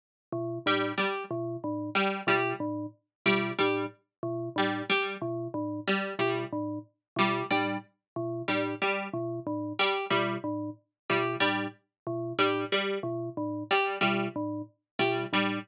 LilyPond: <<
  \new Staff \with { instrumentName = "Glockenspiel" } { \clef bass \time 6/8 \tempo 4. = 61 r8 b,8 a,8 r8 b,8 a,8 | r8 b,8 a,8 r8 b,8 a,8 | r8 b,8 a,8 r8 b,8 a,8 | r8 b,8 a,8 r8 b,8 a,8 |
r8 b,8 a,8 r8 b,8 a,8 | r8 b,8 a,8 r8 b,8 a,8 | r8 b,8 a,8 r8 b,8 a,8 | r8 b,8 a,8 r8 b,8 a,8 | }
  \new Staff \with { instrumentName = "Harpsichord" } { \clef bass \time 6/8 r4 g8 g8 r4 | g8 g8 r4 g8 g8 | r4 g8 g8 r4 | g8 g8 r4 g8 g8 |
r4 g8 g8 r4 | g8 g8 r4 g8 g8 | r4 g8 g8 r4 | g8 g8 r4 g8 g8 | }
>>